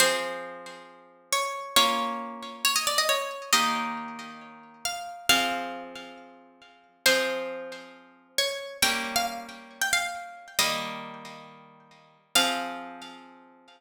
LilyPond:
<<
  \new Staff \with { instrumentName = "Orchestral Harp" } { \time 4/4 \key f \minor \tempo 4 = 136 c''2. des''4 | des''2 des''16 ees''16 d''16 ees''16 des''4 | ees''2. f''4 | f''4. r2 r8 |
c''2. des''4 | g''8. f''16 r4 r16 g''16 f''4. | ees''2 r2 | f''1 | }
  \new Staff \with { instrumentName = "Orchestral Harp" } { \time 4/4 \key f \minor <f c' aes'>1 | <bes des' f'>1 | <ees bes g'>1 | <f c' aes'>1 |
<f c' aes'>1 | <g bes des'>1 | <ees g bes>1 | <f c' aes'>1 | }
>>